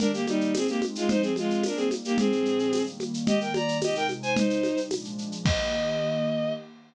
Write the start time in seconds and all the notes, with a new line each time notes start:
0.00 D#3 A#3 D4 G4 A#4, low conga, shaker
0.13 A#3 G4, shaker
0.27 G3 D#4, high conga, shaker
0.41 shaker
0.54 G#3 C4 D#4 G#4, tambourine, high conga, shaker
0.68 A#3 G4, shaker
0.82 high conga, shaker
0.95 G#3 F4, shaker
1.08 F3 G#3 C4 D#4 C5, low conga, shaker
1.22 C4 G#4, shaker
1.36 G#3 F4, high conga, shaker
1.50 shaker
1.63 G3 A#3 D4 D#4 A#4, tambourine, high conga, shaker
1.76 C4 G#4, shaker
1.91 high conga, shaker
2.05 A#3 G4, shaker
2.18 A#2 F3 G#3 C4 D4 G#4, low conga, shaker
2.32 shaker
2.45 shaker
2.59 shaker
2.72 D#3 G3 A#3, tambourine, high conga, shaker
2.86 shaker
3.00 high conga, shaker
3.14 shaker
3.27 D#3 G3 A#3 G4 D#5, low conga, shaker
3.41 A#4 G5, shaker
3.54 D5 A#5, high conga, shaker
3.68 shaker
3.82 C3 G#3 D#4 G4 D#5, tambourine, high conga, shaker
3.95 A#4 G5, shaker
4.09 high conga, shaker
4.23 C5 G#5, shaker
4.36 C3 G3 D#4 C5, low conga, shaker
4.50 shaker
4.63 high conga, shaker
4.77 shaker
4.91 A#2 F3 G#3 D4, tambourine, high conga, shaker
5.04 shaker
5.18 shaker
5.32 shaker
5.45 D#3 A#3 G4 D#5, kick, crash